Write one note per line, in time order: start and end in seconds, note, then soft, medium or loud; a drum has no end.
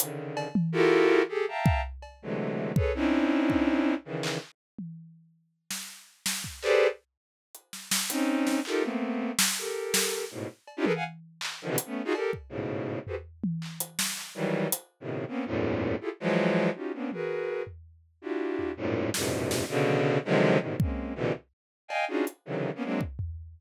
0.00 0.48 C#3 medium
0.00 0.48 D3 medium
0.00 0.48 D#3 medium
0.00 closed hi-hat loud
0.37 cowbell loud
0.55 high tom loud
0.72 1.22 E4 loud
0.72 1.22 F4 loud
0.72 1.22 F#4 loud
0.72 1.22 G4 loud
0.72 1.22 A4 loud
0.72 1.22 A#4 loud
1.29 1.45 G4 medium
1.29 1.45 G#4 medium
1.29 1.45 A4 medium
1.48 1.81 E5 medium
1.48 1.81 F5 medium
1.48 1.81 G5 medium
1.48 1.81 A5 medium
1.48 1.81 A#5 medium
1.66 kick loud
2.02 cowbell medium
2.22 2.72 C3 medium
2.22 2.72 D3 medium
2.22 2.72 E3 medium
2.22 2.72 F#3 medium
2.22 2.72 G#3 medium
2.22 2.72 A3 medium
2.76 2.92 G#4 medium
2.76 2.92 A4 medium
2.76 2.92 B4 medium
2.76 2.92 C#5 medium
2.76 kick loud
2.95 3.94 C4 medium
2.95 3.94 C#4 medium
2.95 3.94 D4 medium
2.95 3.94 D#4 medium
2.95 3.94 E4 medium
3.50 kick medium
4.05 4.38 C#3 medium
4.05 4.38 D#3 medium
4.05 4.38 E3 medium
4.23 clap medium
4.79 high tom medium
5.71 snare medium
6.26 snare medium
6.44 kick medium
6.62 6.87 G4 loud
6.62 6.87 G#4 loud
6.62 6.87 A4 loud
6.62 6.87 B4 loud
6.62 6.87 C5 loud
6.62 6.87 D5 loud
6.62 clap medium
7.55 closed hi-hat medium
7.73 snare medium
7.91 snare loud
8.10 8.60 C4 loud
8.10 8.60 C#4 loud
8.10 8.60 D#4 loud
8.10 closed hi-hat medium
8.47 snare medium
8.65 8.83 D#4 medium
8.65 8.83 F4 medium
8.65 8.83 G4 medium
8.65 8.83 A4 medium
8.65 8.83 A#4 medium
8.65 clap medium
8.82 9.31 A3 medium
8.82 9.31 A#3 medium
8.82 9.31 B3 medium
8.82 9.31 C4 medium
9.39 snare loud
9.58 10.25 G4 medium
9.58 10.25 A4 medium
9.58 10.25 A#4 medium
9.94 snare loud
10.31 10.47 G#2 medium
10.31 10.47 A2 medium
10.31 10.47 B2 medium
10.67 cowbell medium
10.77 10.85 C#4 loud
10.77 10.85 D4 loud
10.77 10.85 D#4 loud
10.77 10.85 E4 loud
10.77 10.85 F4 loud
10.77 10.85 G4 loud
10.84 10.92 G#4 loud
10.84 10.92 A4 loud
10.84 10.92 A#4 loud
10.84 10.92 B4 loud
10.84 high tom medium
10.95 11.04 F5 medium
10.95 11.04 F#5 medium
10.95 11.04 G#5 medium
11.41 clap medium
11.62 11.67 D3 medium
11.62 11.70 D#3 medium
11.62 11.70 F3 medium
11.68 11.76 B2 loud
11.68 11.76 C3 loud
11.68 11.76 D3 loud
11.68 11.76 E3 loud
11.78 closed hi-hat loud
11.86 12.02 A3 medium
11.86 12.02 B3 medium
11.86 12.02 C#4 medium
12.05 12.13 D#4 loud
12.05 12.13 F4 loud
12.05 12.13 F#4 loud
12.05 12.13 G#4 loud
12.14 12.31 G4 medium
12.14 12.31 A4 medium
12.14 12.31 A#4 medium
12.14 cowbell medium
12.33 kick medium
12.49 12.99 G#2 medium
12.49 12.99 A2 medium
12.49 12.99 B2 medium
12.49 12.99 C#3 medium
13.07 13.15 F#4 medium
13.07 13.15 G4 medium
13.07 13.15 G#4 medium
13.07 13.15 A4 medium
13.07 13.15 B4 medium
13.07 13.15 C5 medium
13.07 floor tom medium
13.44 high tom loud
13.62 clap medium
13.80 closed hi-hat loud
13.99 snare medium
14.17 clap medium
14.35 14.68 D#3 medium
14.35 14.68 E3 medium
14.35 14.68 F#3 medium
14.35 14.68 G3 medium
14.72 closed hi-hat loud
15.00 15.25 A2 medium
15.00 15.25 B2 medium
15.00 15.25 C3 medium
15.00 15.25 C#3 medium
15.00 15.25 D#3 medium
15.28 15.44 A#3 medium
15.28 15.44 B3 medium
15.28 15.44 C4 medium
15.28 15.44 C#4 medium
15.45 15.95 E2 medium
15.45 15.95 F#2 medium
15.45 15.95 G#2 medium
15.45 15.95 A2 medium
15.45 15.95 A#2 medium
16.01 16.09 E4 medium
16.01 16.09 F4 medium
16.01 16.09 G4 medium
16.01 16.09 G#4 medium
16.01 16.09 A4 medium
16.20 16.70 E3 loud
16.20 16.70 F3 loud
16.20 16.70 F#3 loud
16.20 16.70 G#3 loud
16.75 16.92 C#4 medium
16.75 16.92 D#4 medium
16.75 16.92 F4 medium
16.75 16.92 F#4 medium
16.75 16.92 G4 medium
16.93 17.10 A#3 medium
16.93 17.10 B3 medium
16.93 17.10 C4 medium
16.93 17.10 C#4 medium
16.93 17.10 D4 medium
17.12 17.62 F#4 medium
17.12 17.62 G#4 medium
17.12 17.62 A#4 medium
17.12 17.62 B4 medium
17.12 high tom medium
17.67 floor tom medium
18.22 18.71 D4 medium
18.22 18.71 E4 medium
18.22 18.71 F4 medium
18.22 18.71 F#4 medium
18.22 18.71 G4 medium
18.59 floor tom soft
18.77 19.10 F#2 medium
18.77 19.10 G#2 medium
18.77 19.10 A2 medium
18.77 19.10 A#2 medium
19.14 19.64 E2 medium
19.14 19.64 F#2 medium
19.14 19.64 G#2 medium
19.14 19.64 A#2 medium
19.14 19.64 B2 medium
19.14 19.64 C3 medium
19.14 snare medium
19.51 snare medium
19.69 20.18 B2 loud
19.69 20.18 C#3 loud
19.69 20.18 D3 loud
19.88 high tom medium
20.25 20.58 C3 loud
20.25 20.58 D3 loud
20.25 20.58 D#3 loud
20.25 20.58 F3 loud
20.25 20.58 F#3 loud
20.25 20.58 G#3 loud
20.59 20.76 G#2 medium
20.59 20.76 A2 medium
20.59 20.76 B2 medium
20.59 20.76 C3 medium
20.59 20.76 D3 medium
20.59 20.76 D#3 medium
20.80 21.14 G#3 soft
20.80 21.14 A#3 soft
20.80 21.14 C4 soft
20.80 21.14 C#4 soft
20.80 kick loud
21.15 21.32 A#2 medium
21.15 21.32 B2 medium
21.15 21.32 C3 medium
21.15 21.32 D3 medium
21.15 21.32 E3 medium
21.88 22.05 D#5 medium
21.88 22.05 F5 medium
21.88 22.05 G5 medium
21.88 22.05 G#5 medium
21.88 cowbell medium
22.08 22.25 C#4 medium
22.08 22.25 D4 medium
22.08 22.25 D#4 medium
22.08 22.25 F4 medium
22.08 22.25 F#4 medium
22.08 22.25 G#4 medium
22.27 closed hi-hat medium
22.45 22.70 C3 medium
22.45 22.70 C#3 medium
22.45 22.70 D3 medium
22.45 22.70 D#3 medium
22.45 22.70 E3 medium
22.45 22.70 F#3 medium
22.75 22.83 A#3 medium
22.75 22.84 B3 medium
22.75 22.84 C#4 medium
22.83 23.00 F#3 medium
22.83 23.00 G#3 medium
22.83 23.00 A#3 medium
22.83 23.00 C4 medium
22.83 23.00 D4 medium
23.01 kick medium
23.19 floor tom medium